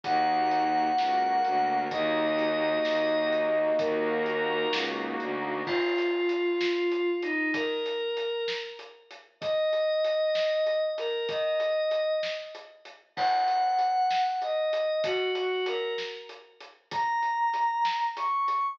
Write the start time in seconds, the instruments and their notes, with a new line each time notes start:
0.04 violin D#2, pad 5 (bowed) A#3 D#4 F#4 F#5, kick, closed hi-hat
0.51 closed hi-hat
0.98 violin C#2, pad 5 (bowed) A#3 F#4 A#4, snare
1.45 violin D2, closed hi-hat
1.91 violin D#2, pad 5 (bowed) A#3 D#4 F#4 D#5, kick, closed hi-hat
2.39 closed hi-hat
2.85 violin D#2, snare
3.32 closed hi-hat
3.79 violin D#2, pad 5 (bowed) A#3 D#4 F#4 A#4, kick, closed hi-hat
4.26 closed hi-hat
4.73 violin C#2, snare
5.20 violin D2, closed hi-hat
5.66 pad 5 (bowed) F4, kick, crash
5.98 closed hi-hat
6.29 closed hi-hat
6.61 snare
6.92 closed hi-hat
7.23 pad 5 (bowed) D#4, closed hi-hat
7.54 pad 5 (bowed) A#4, kick, closed hi-hat
7.86 closed hi-hat
8.17 closed hi-hat
8.48 snare
8.79 closed hi-hat
9.11 closed hi-hat
9.41 pad 5 (bowed) D#5, kick, closed hi-hat
9.73 closed hi-hat
10.05 closed hi-hat
10.35 snare
10.66 closed hi-hat
10.98 pad 5 (bowed) A#4, closed hi-hat
11.29 pad 5 (bowed) D#5, kick, closed hi-hat
11.60 closed hi-hat
11.91 closed hi-hat
12.23 snare
12.55 closed hi-hat
12.85 closed hi-hat
13.17 pad 5 (bowed) F#5, kick, crash
13.48 closed hi-hat
13.79 closed hi-hat
14.11 snare
14.42 pad 5 (bowed) D#5, closed hi-hat
14.73 closed hi-hat
15.04 pad 5 (bowed) F#4, kick, closed hi-hat
15.35 pad 5 (bowed) F#4, closed hi-hat
15.66 pad 5 (bowed) A#4, closed hi-hat
15.98 snare
16.29 closed hi-hat
16.61 closed hi-hat
16.91 pad 5 (bowed) A#5, kick, closed hi-hat
17.23 closed hi-hat
17.54 closed hi-hat
17.85 snare
18.17 pad 5 (bowed) C#6, closed hi-hat
18.48 closed hi-hat